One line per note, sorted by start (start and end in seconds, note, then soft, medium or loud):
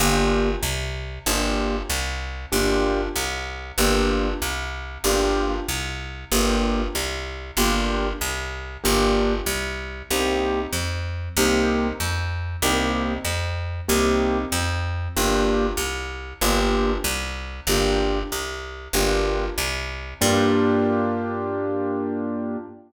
0.00 0.56 G1 medium
0.00 0.50 A#3 medium
0.00 0.50 D4 medium
0.00 0.50 F4 medium
0.00 0.50 G4 medium
0.63 1.19 C2 medium
1.26 1.83 G1 medium
1.26 1.76 A#3 medium
1.26 1.76 D4 medium
1.26 1.76 F4 medium
1.26 1.76 G4 medium
1.89 2.46 C2 medium
2.52 3.09 G1 medium
2.52 3.01 A#3 medium
2.52 3.01 D4 medium
2.52 3.01 F4 medium
2.52 3.01 G4 medium
3.16 3.72 C2 medium
3.78 4.34 G1 medium
3.78 4.28 A#3 medium
3.78 4.28 D4 medium
3.78 4.28 F4 medium
3.78 4.28 G4 medium
4.42 4.98 C2 medium
5.04 5.60 G1 medium
5.04 5.54 A#3 medium
5.04 5.54 D4 medium
5.04 5.54 F4 medium
5.04 5.54 G4 medium
5.68 6.25 C2 medium
6.32 6.88 G1 medium
6.32 6.81 A#3 medium
6.32 6.81 D4 medium
6.32 6.81 F4 medium
6.32 6.81 G4 medium
6.95 7.51 C2 medium
7.57 8.13 G1 medium
7.57 8.07 A#3 medium
7.57 8.07 D4 medium
7.57 8.07 F4 medium
7.57 8.07 G4 medium
8.21 8.77 C2 medium
8.84 9.41 G1 medium
8.84 9.33 A#3 medium
8.84 9.33 D4 medium
8.84 9.33 F4 medium
8.84 9.33 G4 medium
9.46 10.03 C2 medium
10.11 10.67 C2 medium
10.11 10.60 A#3 medium
10.11 10.60 C4 medium
10.11 10.60 D#4 medium
10.11 10.60 G4 medium
10.73 11.29 F2 medium
11.37 11.93 C2 medium
11.37 11.87 A#3 medium
11.37 11.87 C4 medium
11.37 11.87 D#4 medium
11.37 11.87 G4 medium
12.00 12.56 F2 medium
12.62 13.19 C2 medium
12.62 13.13 A#3 medium
12.62 13.13 C4 medium
12.62 13.13 D#4 medium
12.62 13.13 G4 medium
13.25 13.81 F2 medium
13.88 14.45 C2 medium
13.88 14.38 A#3 medium
13.88 14.38 C4 medium
13.88 14.38 D#4 medium
13.88 14.38 G4 medium
14.52 15.08 F2 medium
15.16 15.73 G1 medium
15.16 15.66 A#3 medium
15.16 15.66 D4 medium
15.16 15.66 F4 medium
15.16 15.66 G4 medium
15.77 16.34 C2 medium
16.41 16.98 G1 medium
16.41 16.92 A#3 medium
16.41 16.92 D4 medium
16.41 16.92 F4 medium
16.41 16.92 G4 medium
17.04 17.61 C2 medium
17.67 18.23 G1 medium
17.67 18.19 A#3 medium
17.67 18.19 D4 medium
17.67 18.19 F4 medium
17.67 18.19 G4 medium
18.32 18.88 C2 medium
18.93 19.50 G1 medium
18.93 19.44 A#3 medium
18.93 19.44 D4 medium
18.93 19.44 F4 medium
18.93 19.44 G4 medium
19.58 20.14 C2 medium
20.21 22.57 G2 loud
20.21 22.57 A#3 loud
20.21 22.57 D4 loud
20.21 22.57 F4 loud
20.21 22.57 G4 medium